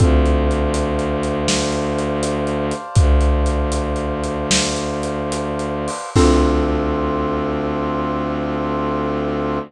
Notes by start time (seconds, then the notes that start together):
0.00 D2 C4 D4 F4 A4 C5 D5 F5 A5, kick, closed hi-hat
0.26 closed hi-hat
0.51 closed hi-hat
0.74 closed hi-hat
0.99 closed hi-hat
1.23 closed hi-hat
1.48 snare
1.72 closed hi-hat
1.99 closed hi-hat
2.23 closed hi-hat
2.47 closed hi-hat
2.71 closed hi-hat
2.95 D2, kick, closed hi-hat
3.21 closed hi-hat
3.46 closed hi-hat
3.72 closed hi-hat
3.96 closed hi-hat
4.24 closed hi-hat
4.51 snare
4.76 closed hi-hat
5.03 closed hi-hat
5.32 closed hi-hat
5.59 closed hi-hat
5.88 open hi-hat
6.16 D2 C4 D4 F4 A4, kick, crash